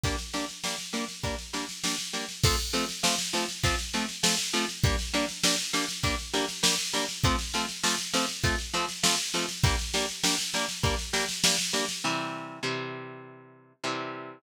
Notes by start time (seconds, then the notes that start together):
0.04 G3 A#3 D4, kick, snare
0.18 snare
0.33 G3 A#3 D4, snare
0.49 snare
0.64 G3 A#3 D4, snare
0.79 snare
0.93 G3 A#3 D4, snare
1.09 snare
1.23 G3 A#3 D4, kick, snare
1.39 snare
1.53 G3 A#3 D4, snare
1.69 snare
1.84 G3 A#3 D4, snare
1.99 snare
2.13 G3 A#3 D4, snare
2.29 snare
2.44 F3 A3 C4, kick, snare, crash
2.59 snare
2.73 F3 A3 C4, snare
2.89 snare
3.03 F3 A3 C4, snare
3.19 snare
3.33 F3 A3 C4, snare
3.49 snare
3.64 F3 A3 C4, kick, snare
3.79 snare
3.94 F3 A3 C4, snare
4.09 snare
4.23 F3 A3 C4, snare
4.39 snare
4.54 F3 A3 C4, snare
4.69 snare
4.84 G3 A#3 D4, kick, snare
4.99 snare
5.14 G3 A#3 D4, snare
5.29 snare
5.44 G3 A#3 D4, snare
5.59 snare
5.73 G3 A#3 D4, snare
5.89 snare
6.03 G3 A#3 D4, kick, snare
6.19 snare
6.33 G3 A#3 D4, snare
6.49 snare
6.63 G3 A#3 D4, snare
6.79 snare
6.93 G3 A#3 D4, snare
7.09 snare
7.24 F3 A3 C4, kick, snare
7.39 snare
7.54 F3 A3 C4, snare
7.69 snare
7.83 F3 A3 C4, snare
7.99 snare
8.13 F3 A3 C4, snare
8.29 snare
8.44 F3 A3 C4, kick, snare
8.59 snare
8.74 F3 A3 C4, snare
8.89 snare
9.03 F3 A3 C4, snare
9.19 snare
9.34 F3 A3 C4, snare
9.49 snare
9.64 G3 A#3 D4, kick, snare
9.79 snare
9.94 G3 A#3 D4, snare
10.09 snare
10.23 G3 A#3 D4, snare
10.39 snare
10.54 G3 A#3 D4, snare
10.69 snare
10.83 G3 A#3 D4, kick, snare
10.99 snare
11.13 G3 A#3 D4, snare
11.29 snare
11.44 G3 A#3 D4, snare
11.59 snare
11.73 G3 A#3 D4, snare
11.89 snare
12.04 C3 E3 G3
12.63 C3 E3 G3
13.84 C3 E3 G3